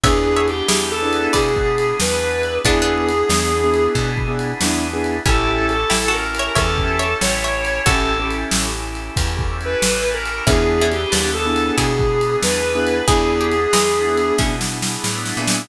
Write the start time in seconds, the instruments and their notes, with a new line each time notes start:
0.04 electric bass (finger) E2, drawbar organ B3 D4 E4 G#4, acoustic grand piano B3 D4 E4 G#4, distortion guitar G#4, pizzicato strings C#5 E5, kick, ride
0.36 pizzicato strings C#5 E5
0.48 distortion guitar G4, ride
0.68 electric bass (finger) E2, pizzicato strings E4 G#4, snare
0.91 distortion guitar A4
1.03 acoustic grand piano B3 D4 E4 G#4
1.13 ride
1.33 electric bass (finger) B2, distortion guitar G#4, pizzicato strings B4 D5, kick, ride
1.56 kick
1.78 ride
2.00 electric bass (finger) E2, distortion guitar B4, snare
2.43 ride
2.64 electric bass (finger) E2, acoustic grand piano B3 D4 E4 G#4, drawbar organ B3 D4 E4 G#4, pizzicato strings B3 D4, distortion guitar G#4, kick, ride
2.82 pizzicato strings B3 D4
3.09 ride
3.29 electric bass (finger) E2, acoustic grand piano B3 D4 E4 G#4, snare
3.64 acoustic grand piano B3 D4 E4 G#4
3.74 ride
3.95 electric bass (finger) B2, kick, ride
4.17 kick
4.28 acoustic grand piano B3 D4 E4 G#4
4.39 ride
4.61 electric bass (finger) E2, acoustic grand piano B3 D4 E4 G#4, snare
4.93 acoustic grand piano B3 D4 E4 G#4
5.04 ride
5.26 electric bass (finger) A1, acoustic grand piano C#4 E4 G4 A4, pizzicato strings C#4 E4, drawbar organ C#4 E4 G4 A4, distortion guitar A4, kick, ride
5.68 distortion guitar A4, ride
5.90 electric bass (finger) A1, pizzicato strings E4 G4, snare
6.08 pizzicato strings F#4 A4
6.12 distortion guitar A#4
6.35 ride
6.39 pizzicato strings C#5 E5
6.55 electric bass (finger) E2, acoustic grand piano C#4 E4 G4 A4, distortion guitar A4, pizzicato strings C#5 E5, kick, ride
6.78 kick
6.99 pizzicato strings C#5 E5, ride
7.21 electric bass (finger) A1, distortion guitar C#5, snare
7.44 pizzicato strings C#5 E5
7.65 ride
7.86 electric bass (finger) A1, drawbar organ C#4 E4 G4 A4, acoustic grand piano C#4 E4 G4 A4, pizzicato strings F#4 A4, distortion guitar A4, kick, ride
8.20 acoustic grand piano C#4 E4 G4 A4
8.30 ride
8.51 electric bass (finger) A1, snare
8.95 ride
9.16 electric bass (finger) E2, kick, ride
9.39 kick
9.61 ride
9.65 distortion guitar B4
9.82 electric bass (finger) A1, snare
10.14 distortion guitar A#4
10.25 ride
10.47 electric bass (finger) E2, acoustic grand piano B3 D4 E4 G#4, drawbar organ B3 D4 E4 G#4, pizzicato strings C#4 E4, distortion guitar G#4, kick, ride
10.81 pizzicato strings C#4 E4
10.92 distortion guitar G4, ride
11.12 electric bass (finger) D#2, pizzicato strings B4 D5, snare
11.34 distortion guitar A4
11.45 acoustic grand piano B3 D4 E4 G#4
11.56 ride
11.78 electric bass (finger) B2, pizzicato strings E4 G#4, distortion guitar G#4, kick, ride
11.99 kick
12.21 ride
12.43 electric bass (finger) E2, distortion guitar B4, snare
12.75 acoustic grand piano B3 D4 E4 G#4
12.87 ride
13.08 electric bass (finger) E2, acoustic grand piano B3 D4 E4 G#4, drawbar organ B3 D4 E4 G#4, pizzicato strings E4 G#4, distortion guitar G#4, kick, ride
13.41 pizzicato strings G4
13.51 ride
13.73 electric bass (finger) E2, pizzicato strings E3 G#3, snare
14.07 acoustic grand piano B3 D4 E4 G#4
14.17 ride
14.38 electric bass (finger) B2, pizzicato strings C#4 E4, kick, snare
14.61 snare
14.82 snare
15.04 electric bass (finger) A2, snare
15.26 snare
15.37 electric bass (finger) A#2, acoustic grand piano B3 D4 E4 G#4
15.47 snare